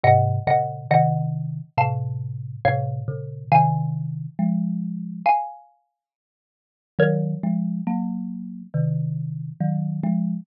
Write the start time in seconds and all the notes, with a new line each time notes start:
0.04 G#2 C3 D#5 F#5
0.47 A#2 C#3 D#5 F#5
0.91 C3 D#3 D#5 F#5
1.78 A2 C3 F5 A5
2.65 A2 C3 C#5 F5
3.08 A#2 C#3
3.52 C3 D#3 F5 G#5
4.39 F3 G#3
5.26 F5 G#5
6.99 D#3 F#3 A#4 C#5
7.43 F3 G#3
7.87 F#3 A#3
8.74 C3 D#3
9.61 D#3 F#3
10.03 F3 G#3